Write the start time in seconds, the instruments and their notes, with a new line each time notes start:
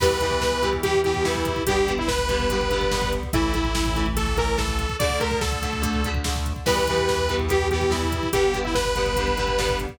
0.00 synth bass 1 E2, overdriven guitar E3 G3 B3, lead 2 (sawtooth) B4, kick, crash
0.10 kick
0.20 overdriven guitar E3 G3 B3, kick, closed hi-hat
0.31 kick
0.41 kick, snare
0.52 kick
0.62 overdriven guitar E3 G3 B3, kick, closed hi-hat
0.73 kick
0.83 overdriven guitar E3 G3 B3, lead 2 (sawtooth) G4, kick, closed hi-hat
0.94 kick
1.04 overdriven guitar E3 G3 B3, lead 2 (sawtooth) G4, kick, closed hi-hat
1.14 kick
1.24 overdriven guitar E3 G3 B3, lead 2 (sawtooth) E4, kick, snare
1.35 kick
1.45 kick, closed hi-hat
1.56 kick
1.66 synth bass 1 G1, overdriven guitar D3 G3 B3, lead 2 (sawtooth) G4, kick, closed hi-hat
1.77 kick
1.87 overdriven guitar D3 G3 B3, kick, closed hi-hat
1.98 lead 2 (sawtooth) E4, kick
2.08 lead 2 (sawtooth) B4, kick, snare
2.18 kick
2.29 overdriven guitar D3 G3 B3, kick, closed hi-hat
2.40 kick
2.50 overdriven guitar D3 G3 B3, kick, closed hi-hat
2.61 kick
2.70 overdriven guitar D3 G3 B3, kick, closed hi-hat
2.81 kick
2.91 overdriven guitar D3 G3 B3, kick, snare
3.02 kick
3.12 kick, closed hi-hat
3.23 kick
3.33 synth bass 1 A1, overdriven guitar E3 A3, lead 2 (sawtooth) E4, kick, closed hi-hat
3.43 kick
3.54 overdriven guitar E3 A3, kick, closed hi-hat
3.64 kick
3.75 kick, snare
3.86 kick
3.96 overdriven guitar E3 A3, kick, closed hi-hat
4.06 kick
4.16 overdriven guitar E3 A3, lead 2 (sawtooth) A4, kick, closed hi-hat
4.27 kick
4.37 overdriven guitar E3 A3, lead 2 (sawtooth) A#4, kick, closed hi-hat
4.48 kick
4.58 overdriven guitar E3 A3, lead 2 (sawtooth) A4, kick, snare
4.68 kick
4.79 kick, closed hi-hat
4.89 kick
4.99 synth bass 1 D2, overdriven guitar D3 A3, lead 2 (sawtooth) D5, kick, closed hi-hat
5.10 kick
5.20 overdriven guitar D3 A3, lead 2 (sawtooth) A#4, kick, closed hi-hat
5.31 kick
5.41 lead 2 (sawtooth) A4, kick, snare
5.52 kick
5.62 overdriven guitar D3 A3, kick, closed hi-hat
5.73 kick
5.82 overdriven guitar D3 A3, kick, closed hi-hat
5.93 kick
6.04 overdriven guitar D3 A3, kick, closed hi-hat
6.15 kick
6.24 overdriven guitar D3 A3, kick, snare
6.36 kick
6.46 kick, closed hi-hat
6.56 kick
6.66 synth bass 1 E2, overdriven guitar E3 G3 B3, lead 2 (sawtooth) B4, kick, crash
6.77 kick
6.87 overdriven guitar E3 G3 B3, kick, closed hi-hat
6.98 kick
7.08 kick, snare
7.18 kick
7.29 overdriven guitar E3 G3 B3, kick, closed hi-hat
7.39 kick
7.48 overdriven guitar E3 G3 B3, lead 2 (sawtooth) G4, kick, closed hi-hat
7.61 kick
7.71 overdriven guitar E3 G3 B3, lead 2 (sawtooth) G4, kick, closed hi-hat
7.81 kick
7.90 overdriven guitar E3 G3 B3, lead 2 (sawtooth) E4, kick, snare
8.03 kick
8.12 kick, closed hi-hat
8.23 kick
8.33 synth bass 1 G1, overdriven guitar D3 G3 B3, lead 2 (sawtooth) G4, kick, closed hi-hat
8.44 kick
8.53 overdriven guitar D3 G3 B3, kick, closed hi-hat
8.64 lead 2 (sawtooth) E4, kick
8.75 lead 2 (sawtooth) B4, kick, snare
8.85 kick
8.96 overdriven guitar D3 G3 B3, kick, closed hi-hat
9.06 kick
9.16 overdriven guitar D3 G3 B3, kick, closed hi-hat
9.27 kick
9.37 overdriven guitar D3 G3 B3, kick, closed hi-hat
9.47 kick
9.58 overdriven guitar D3 G3 B3, kick, snare
9.69 kick
9.79 kick, closed hi-hat
9.89 kick